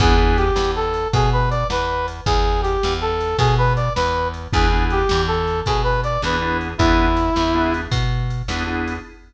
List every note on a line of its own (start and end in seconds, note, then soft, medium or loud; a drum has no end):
0.00 0.51 E2 medium
0.00 0.14 B3 loud
0.00 0.14 D4 loud
0.00 0.14 E4 loud
0.00 0.37 G#4 loud
0.00 0.14 G#4 loud
0.00 kick loud
0.00 crash loud
0.18 0.44 B3 medium
0.18 0.44 D4 medium
0.18 0.44 E4 loud
0.18 0.44 G#4 medium
0.37 0.71 G4 loud
0.37 ride medium
0.56 1.07 E2 medium
0.56 snare loud
0.76 1.08 A4 loud
0.94 ride medium
1.13 1.64 B2 medium
1.13 1.30 G#4 loud
1.13 kick medium
1.13 ride loud
1.33 1.49 B4 loud
1.51 1.67 D5 loud
1.51 ride medium
1.70 2.21 E2 medium
1.70 2.06 B4 loud
1.70 snare loud
2.08 ride medium
2.26 2.77 E2 medium
2.26 2.61 G#4 loud
2.26 kick loud
2.26 ride loud
2.62 2.93 G4 loud
2.62 ride medium
2.83 3.35 E2 medium
2.83 snare loud
3.01 3.37 A4 loud
3.20 ride medium
3.38 3.89 B2 medium
3.38 3.55 G#4 loud
3.38 kick medium
3.38 ride loud
3.58 3.73 B4 loud
3.76 3.93 D5 medium
3.76 ride medium
3.96 4.48 E2 medium
3.96 4.28 B4 loud
3.96 snare loud
4.34 ride medium
4.53 5.04 E2 medium
4.53 4.66 B3 loud
4.53 4.66 D4 loud
4.53 4.66 E4 loud
4.53 4.66 G#4 loud
4.53 4.85 G#4 loud
4.53 kick loud
4.53 ride loud
4.72 4.99 B3 loud
4.72 4.99 D4 medium
4.72 4.99 E4 loud
4.72 4.99 G#4 medium
4.90 5.22 G4 loud
4.90 ride medium
5.09 5.62 E2 medium
5.09 snare loud
5.27 5.60 A4 loud
5.47 ride medium
5.66 6.18 B2 medium
5.66 5.82 G#4 loud
5.66 kick medium
5.66 ride loud
5.84 6.01 B4 loud
6.03 6.22 D5 loud
6.03 ride medium
6.22 6.74 E2 medium
6.22 6.36 B3 loud
6.22 6.36 D4 loud
6.22 6.36 E4 medium
6.22 6.36 G#4 loud
6.22 6.57 B4 medium
6.22 snare loud
6.42 6.68 B3 medium
6.42 6.68 D4 medium
6.42 6.68 E4 medium
6.42 6.68 G#4 medium
6.61 ride medium
6.78 7.30 E2 medium
6.78 7.06 B3 loud
6.78 7.06 D4 loud
6.78 7.74 E4 loud
6.78 7.06 E4 loud
6.78 7.06 G#4 loud
6.78 kick loud
6.78 ride loud
7.17 ride medium
7.36 7.87 E2 medium
7.36 snare loud
7.55 7.81 B3 loud
7.55 7.81 D4 loud
7.55 7.81 E4 loud
7.55 7.81 G#4 medium
7.74 ride medium
7.92 8.42 B2 medium
7.92 kick medium
7.92 ride loud
8.30 ride medium
8.48 8.99 E2 medium
8.48 8.63 B3 loud
8.48 8.63 D4 medium
8.48 8.63 E4 loud
8.48 8.63 G#4 loud
8.48 snare loud
8.67 8.93 B3 medium
8.67 8.93 D4 medium
8.67 8.93 E4 loud
8.67 8.93 G#4 medium
8.87 ride medium